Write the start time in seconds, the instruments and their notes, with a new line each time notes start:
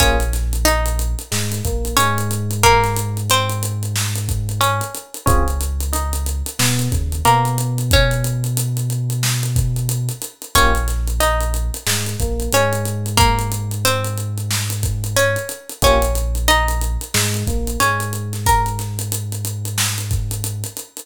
0.00 synth bass 2 A#1, electric piano 1 A#3 C#4 F4 G#4, pizzicato strings C#4 C#5, kick, closed hi-hat
0.20 closed hi-hat
0.33 snare, closed hi-hat
0.53 closed hi-hat
0.65 pizzicato strings D#4 D#5, closed hi-hat
0.86 closed hi-hat
0.99 closed hi-hat
1.19 closed hi-hat
1.31 synth bass 2 G#2, electric piano 1 G#3, snare
1.52 snare, closed hi-hat
1.65 synth bass 2 A#1, electric piano 1 A#3, kick, closed hi-hat
1.85 closed hi-hat
1.97 synth bass 2 G#2, electric piano 1 G#3, pizzicato strings C#4 C#5, closed hi-hat
2.18 closed hi-hat
2.31 closed hi-hat
2.51 closed hi-hat
2.63 pizzicato strings A#3 A#4, kick, closed hi-hat
2.84 snare, closed hi-hat
2.97 closed hi-hat
3.17 closed hi-hat
3.30 pizzicato strings C4 C5, closed hi-hat
3.50 closed hi-hat
3.63 closed hi-hat
3.83 closed hi-hat
3.96 snare
4.16 closed hi-hat
4.29 kick, closed hi-hat
4.49 closed hi-hat
4.61 pizzicato strings C#4 C#5, closed hi-hat
4.81 closed hi-hat
4.95 closed hi-hat
5.14 closed hi-hat
5.26 synth bass 2 C#2, electric piano 1 C4 C#4 F4 G#4, pizzicato strings C#4 C#5, kick, closed hi-hat
5.48 closed hi-hat
5.61 closed hi-hat
5.80 closed hi-hat
5.93 pizzicato strings D#4 D#5, closed hi-hat
6.13 closed hi-hat
6.26 closed hi-hat
6.46 closed hi-hat
6.59 synth bass 2 B2, electric piano 1 B3, snare
6.79 closed hi-hat
6.92 synth bass 2 D#2, electric piano 1 C#3, kick, closed hi-hat
7.12 closed hi-hat
7.25 synth bass 2 B2, pizzicato strings A#3 A#4, electric piano 1 B3, closed hi-hat
7.45 closed hi-hat
7.58 closed hi-hat
7.78 closed hi-hat
7.91 pizzicato strings C#4 C#5, kick, closed hi-hat
8.11 closed hi-hat
8.24 closed hi-hat
8.44 closed hi-hat
8.57 closed hi-hat
8.77 closed hi-hat
8.90 closed hi-hat
9.10 closed hi-hat
9.23 snare
9.43 closed hi-hat
9.56 kick, closed hi-hat
9.76 closed hi-hat
9.89 closed hi-hat
10.09 closed hi-hat
10.22 closed hi-hat
10.42 closed hi-hat
10.55 synth bass 2 A#1, electric piano 1 A#3 C#4 F4 G4, pizzicato strings C#4 C#5, kick, closed hi-hat
10.75 closed hi-hat
10.88 snare, closed hi-hat
11.08 closed hi-hat
11.20 pizzicato strings D#4 D#5, closed hi-hat
11.41 closed hi-hat
11.54 closed hi-hat
11.74 closed hi-hat
11.87 synth bass 2 G#2, electric piano 1 G#3, snare
12.06 closed hi-hat
12.20 synth bass 2 A#1, electric piano 1 A#3, kick, closed hi-hat
12.40 closed hi-hat
12.52 synth bass 2 G#2, electric piano 1 G#3, pizzicato strings C#4 C#5, closed hi-hat
12.73 closed hi-hat
12.85 closed hi-hat
13.06 closed hi-hat
13.17 pizzicato strings A#3 A#4, kick, closed hi-hat
13.39 closed hi-hat
13.52 closed hi-hat
13.71 closed hi-hat
13.85 pizzicato strings C4 C5, closed hi-hat
14.05 closed hi-hat
14.18 closed hi-hat
14.38 closed hi-hat
14.51 snare
14.70 closed hi-hat
14.83 kick, closed hi-hat
15.04 closed hi-hat
15.16 pizzicato strings C#4 C#5, closed hi-hat
15.36 closed hi-hat
15.49 closed hi-hat
15.70 closed hi-hat
15.82 synth bass 2 A#1, electric piano 1 A#3 C#4 F4 G4, pizzicato strings C#4 C#5, kick, closed hi-hat
16.02 closed hi-hat
16.15 closed hi-hat
16.35 closed hi-hat
16.48 pizzicato strings D#4 D#5, closed hi-hat
16.68 closed hi-hat
16.81 closed hi-hat
17.01 closed hi-hat
17.14 synth bass 2 G#2, electric piano 1 G#3, snare
17.34 closed hi-hat
17.47 synth bass 2 A#1, electric piano 1 A#3, kick, closed hi-hat
17.67 closed hi-hat
17.80 synth bass 2 G#2, electric piano 1 G#3, pizzicato strings C#4 C#5, closed hi-hat
18.00 closed hi-hat
18.13 closed hi-hat
18.33 snare, closed hi-hat
18.46 pizzicato strings A#4 A#5, kick, closed hi-hat
18.66 closed hi-hat
18.79 snare, closed hi-hat
18.99 closed hi-hat
19.12 closed hi-hat
19.32 closed hi-hat
19.45 closed hi-hat
19.65 closed hi-hat
19.78 snare
19.98 closed hi-hat
20.11 kick, closed hi-hat
20.31 closed hi-hat
20.44 closed hi-hat
20.64 closed hi-hat
20.77 closed hi-hat
20.97 closed hi-hat